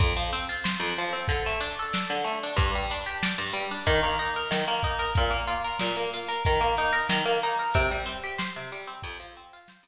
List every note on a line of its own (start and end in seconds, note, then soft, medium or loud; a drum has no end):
0.00 0.14 F2 loud
0.00 kick loud
0.00 closed hi-hat loud
0.17 0.31 F3 medium
0.33 0.47 C4 loud
0.33 closed hi-hat medium
0.49 0.64 F4 medium
0.64 0.79 C5 medium
0.64 snare loud
0.80 0.94 F2 medium
0.96 1.13 F3 medium
0.96 closed hi-hat loud
1.13 1.27 C4 medium
1.28 1.43 D3 loud
1.28 kick loud
1.28 closed hi-hat loud
1.46 1.61 A3 medium
1.60 1.75 D4 loud
1.60 closed hi-hat medium
1.79 1.94 A4 medium
1.93 2.08 D5 loud
1.93 snare loud
2.10 2.24 D3 medium
2.24 2.39 A3 medium
2.24 closed hi-hat medium
2.43 2.58 D4 medium
2.56 2.71 G2 loud
2.56 kick loud
2.56 closed hi-hat loud
2.75 2.90 G3 medium
2.90 3.06 D4 medium
2.90 closed hi-hat medium
3.06 3.21 G4 medium
3.23 3.37 D5 medium
3.23 snare loud
3.38 3.53 G2 loud
3.53 3.68 G3 loud
3.53 closed hi-hat medium
3.71 3.86 D4 medium
3.86 4.01 D#3 loud
3.86 kick loud
3.86 closed hi-hat loud
4.03 4.17 A#3 loud
4.19 4.34 D#4 medium
4.19 closed hi-hat medium
4.36 4.51 A#4 medium
4.51 4.65 D#3 medium
4.51 snare loud
4.68 4.82 A#3 medium
4.83 4.98 D#4 medium
4.83 kick loud
4.83 closed hi-hat medium
4.99 5.14 A#4 medium
5.15 5.32 A#2 loud
5.15 kick loud
5.15 closed hi-hat loud
5.30 5.45 A#3 medium
5.47 5.62 F4 medium
5.47 closed hi-hat medium
5.64 5.79 A#4 loud
5.79 5.95 A#2 loud
5.79 snare loud
5.97 6.11 A#3 medium
6.13 6.28 F4 medium
6.13 closed hi-hat medium
6.28 6.43 A#4 loud
6.45 6.61 D#3 loud
6.45 kick loud
6.45 closed hi-hat loud
6.61 6.75 A#3 loud
6.77 6.93 D#4 loud
6.77 closed hi-hat medium
6.93 7.07 A#4 loud
7.09 7.24 D#3 loud
7.09 snare loud
7.26 7.40 A#3 loud
7.42 7.58 D#4 medium
7.42 closed hi-hat medium
7.59 7.74 A#4 medium
7.74 7.89 C3 loud
7.74 kick loud
7.74 closed hi-hat loud
7.91 8.06 G3 medium
8.06 8.20 C4 loud
8.06 closed hi-hat loud
8.24 8.38 G4 loud
8.38 8.53 C5 loud
8.38 snare loud
8.56 8.71 C3 medium
8.71 8.87 G3 loud
8.71 closed hi-hat medium
8.87 9.02 C4 medium
9.02 9.18 F2 loud
9.02 kick loud
9.02 closed hi-hat loud
9.20 9.34 F3 medium
9.34 9.51 C4 medium
9.34 closed hi-hat medium
9.53 9.68 F4 loud
9.68 9.84 C5 medium
9.68 snare loud
9.83 9.87 F2 loud